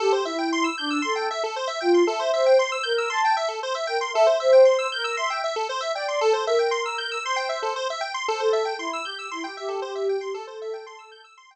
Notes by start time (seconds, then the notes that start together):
0.00 G4 A4
0.12 C5
0.25 E4 E5
0.38 G5
0.52 C6
0.64 E6
0.78 D4 G6
0.90 E6
1.02 A4 C6
1.16 G5
1.31 E5
1.44 A4
1.56 C5
1.67 E5
1.80 F4 G5
1.94 C6
2.07 A4 E5
2.19 C5
2.33 C5 E5
2.46 G5
2.59 C6
2.72 E6
2.83 A#4 G6
2.98 E6
3.10 A5 C6
3.25 G5
3.37 E5
3.48 A4
3.63 C5
3.75 E5
3.87 A#4 G5
4.01 C6
4.14 A4 E5
4.27 C5
4.40 C5 E5
4.52 G5
4.65 C6
4.78 E6
4.92 A#4 G6
5.04 E6
5.17 E5 C6
5.30 G5
5.44 E5
5.56 A4
5.69 C5
5.81 E5
5.95 D5 G5
6.08 C6
6.21 A4
6.33 C5
6.46 A#4 E5
6.59 G5
6.71 C6
6.86 E6
6.98 G6
7.12 E6
7.23 C5 C6
7.36 G5
7.49 E5
7.62 A4
7.76 C5
7.90 E5
8.01 G5
8.14 C6
8.28 A4 C5
8.40 A4 C5
8.53 E5
8.65 G5
8.79 E4 C6
8.93 E6
9.04 G4 G6
9.19 E6
9.31 E4 C6
9.44 G4 G5
9.57 G4 E5
9.69 A4
9.82 G4 C5
9.95 E5
10.09 G5
10.21 G4 C6
10.34 A4
10.47 C5
10.62 E5
10.73 G5
10.86 C6
10.99 E6
11.11 G6
11.24 E6
11.37 C6
11.51 G5